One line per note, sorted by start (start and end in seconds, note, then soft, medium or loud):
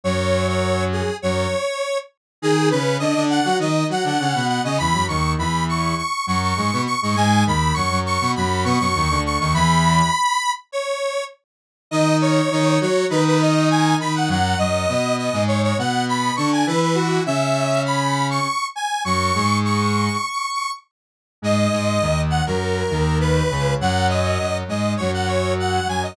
0.04 1.02 F#2 medium
0.04 1.02 F#3 medium
0.04 0.47 C#5 medium
0.48 0.84 C#5 medium
0.92 1.16 G#4 medium
1.22 1.47 F#2 medium
1.22 1.47 F#3 medium
1.22 1.98 C#5 medium
2.42 2.70 D#3 medium
2.42 2.70 D#4 medium
2.42 2.69 G#4 medium
2.70 2.98 C#3 medium
2.70 2.98 C#4 medium
2.70 2.97 B4 medium
2.99 3.14 D3 medium
2.99 3.14 D4 medium
2.99 3.24 D#5 medium
3.15 3.40 D3 medium
3.15 3.40 D4 medium
3.30 3.57 F#5 medium
3.45 3.59 F#3 medium
3.45 3.59 F#4 medium
3.59 3.84 D#3 medium
3.59 3.84 D#4 medium
3.59 3.87 D#5 medium
3.89 4.03 F#3 medium
3.89 4.03 F#4 medium
3.89 4.05 F#5 medium
4.04 4.18 D3 medium
4.04 4.18 D4 medium
4.04 4.47 F#5 medium
4.19 4.33 C#3 medium
4.19 4.33 C#4 medium
4.35 4.60 B2 medium
4.35 4.60 B3 medium
4.48 4.62 F#5 medium
4.64 4.78 C#3 medium
4.64 4.78 C#4 medium
4.64 4.78 D#5 medium
4.78 4.94 E2 medium
4.78 4.94 E3 medium
4.78 5.05 B5 medium
4.93 5.07 F#2 medium
4.93 5.07 F#3 medium
5.08 5.36 D#2 medium
5.08 5.36 D#3 medium
5.08 5.32 C#6 medium
5.38 5.94 E2 medium
5.38 5.94 E3 medium
5.38 5.64 B5 medium
5.69 5.96 C#6 medium
5.97 6.25 C#6 medium
6.27 6.53 F#2 medium
6.27 6.53 F#3 medium
6.27 6.41 C#6 medium
6.42 6.82 C#6 medium
6.56 6.71 G#2 medium
6.56 6.71 G#3 medium
6.73 6.87 B2 medium
6.73 6.87 B3 medium
6.86 7.00 C#6 medium
7.01 7.15 G#2 medium
7.01 7.15 G#3 medium
7.01 7.15 C#6 medium
7.16 7.44 G#2 medium
7.16 7.44 G#3 medium
7.16 7.44 G#5 medium
7.46 7.72 D#2 medium
7.46 7.72 D#3 medium
7.46 7.74 B5 medium
7.74 7.90 F#2 medium
7.74 7.90 F#3 medium
7.74 7.99 C#6 medium
7.90 8.18 F#2 medium
7.90 8.18 F#3 medium
8.06 8.31 C#6 medium
8.21 8.35 B2 medium
8.21 8.35 B3 medium
8.36 8.65 F#2 medium
8.36 8.65 F#3 medium
8.36 8.63 B5 medium
8.64 8.78 B2 medium
8.64 8.78 B3 medium
8.64 8.78 C#6 medium
8.79 8.94 F#2 medium
8.79 8.94 F#3 medium
8.79 9.21 C#6 medium
8.95 9.09 D#2 medium
8.95 9.09 D#3 medium
9.10 9.38 D2 medium
9.10 9.38 D3 medium
9.26 9.39 C#6 medium
9.39 9.53 D#2 medium
9.39 9.53 D#3 medium
9.39 9.53 C#6 medium
9.53 10.02 E2 medium
9.53 10.02 E3 medium
9.53 10.51 B5 loud
10.72 11.24 C#5 medium
11.91 12.41 D#3 medium
11.91 12.41 D#4 medium
11.91 12.16 D#5 medium
12.22 12.79 C#5 medium
12.51 12.78 D#3 medium
12.51 12.78 D#4 medium
12.81 13.05 F#3 medium
12.81 13.05 F#4 medium
12.81 13.06 C#5 medium
13.10 13.95 D#3 medium
13.10 13.95 D#4 medium
13.10 13.24 B4 medium
13.27 13.41 B4 medium
13.41 13.69 D#5 medium
13.70 13.96 G#5 medium
14.00 14.29 D#3 medium
14.00 14.29 D#4 medium
14.00 14.14 B5 medium
14.15 14.29 F#5 medium
14.28 14.55 F#2 medium
14.28 14.55 F#3 medium
14.28 14.58 F#5 medium
14.58 14.86 F#2 medium
14.58 14.86 F#3 medium
14.58 15.16 D#5 medium
14.88 15.29 B2 medium
14.88 15.29 B3 medium
15.18 15.43 D#5 medium
15.33 15.73 G#2 medium
15.33 15.73 G#3 medium
15.47 15.62 C#5 medium
15.63 15.77 C#5 medium
15.78 16.31 B2 medium
15.78 16.31 B3 medium
15.78 16.05 F#5 medium
16.09 16.34 B5 medium
16.36 16.64 D3 medium
16.36 16.64 D4 medium
16.36 16.50 C#6 medium
16.52 16.66 G#5 medium
16.67 17.19 E3 medium
16.67 17.19 E4 medium
16.67 16.81 B4 medium
16.82 16.96 B4 medium
16.95 17.23 F#4 medium
17.26 18.39 C#3 medium
17.26 18.39 C#4 medium
17.26 17.81 E5 medium
17.86 18.27 B5 medium
18.30 18.66 C#6 medium
18.75 19.02 G#5 medium
19.05 19.32 F#2 medium
19.05 19.32 F#3 medium
19.05 19.58 C#6 medium
19.35 20.09 G#2 medium
19.35 20.09 G#3 medium
19.65 20.71 C#6 medium
21.42 21.68 G#2 medium
21.42 21.68 G#3 medium
21.42 22.21 D#5 medium
21.72 21.99 G#2 medium
21.72 21.99 G#3 medium
22.01 22.42 D#2 medium
22.01 22.42 D#3 medium
22.30 22.44 F#5 medium
22.46 22.83 F#2 medium
22.46 22.83 F#3 medium
22.46 23.18 A#4 medium
22.90 23.42 D#2 medium
22.90 23.42 D#3 medium
23.20 23.74 B4 medium
23.50 23.75 C#2 medium
23.50 23.75 C#3 medium
23.81 24.38 F#2 medium
23.81 24.38 F#3 medium
23.81 24.07 F#5 medium
24.09 24.57 D#5 medium
24.39 24.63 F#2 medium
24.39 24.63 F#3 medium
24.68 24.95 G#2 medium
24.68 24.95 G#3 medium
24.68 24.93 D#5 medium
24.97 25.80 F#2 medium
24.97 25.80 F#3 medium
24.97 25.11 C#5 medium
25.14 25.28 F#5 medium
25.27 25.53 C#5 medium
25.60 25.88 F#5 medium
25.87 26.14 F#2 medium
25.87 26.14 F#3 medium
25.87 26.02 G#5 medium
26.03 26.16 D#5 medium